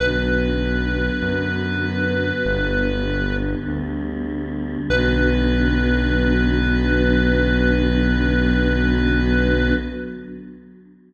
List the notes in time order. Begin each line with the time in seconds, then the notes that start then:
0.00 B1 D3 F#3 B3 B4
1.22 F#2
2.45 G1 D3 G3 B3
3.67 D2
4.90 B1 D3 F#3 B3 B4